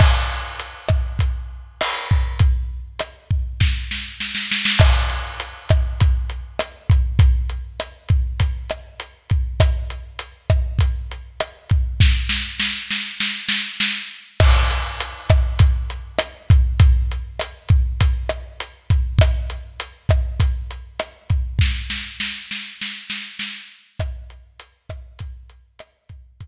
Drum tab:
CC |x---------------|----------------|x---------------|----------------|
HH |----x---x---o---|x---x-----------|--x-x-x-x-x-x-x-|x-x-x-x-x-x-x-x-|
SD |r-----r-----r---|----r---o-o-oooo|r-----r-----r---|----r-----r-----|
BD |o-----o-o-----o-|o-----o-o-------|o-----o-o-----o-|o-----o-o-----o-|

CC |----------------|----------------|x---------------|----------------|
HH |x-x-x-x-x-x-x-x-|----------------|--x-x-x-x-x-x-x-|x-x-x-x-x-x-x-x-|
SD |r-----r-----r---|o-o-o-o-o-o-o---|r-----r-----r---|----r-----r-----|
BD |o-----o-o-----o-|o---------------|o-----o-o-----o-|o-----o-o-----o-|

CC |----------------|----------------|----------------|----------------|
HH |x-x-x-x-x-x-x-x-|----------------|x-x-x-x-x-x-x-x-|x---------------|
SD |r-----r-----r---|o-o-o-o-o-o-o---|r-----r-----r---|----------------|
BD |o-----o-o-----o-|o---------------|o-----o-o-----o-|o---------------|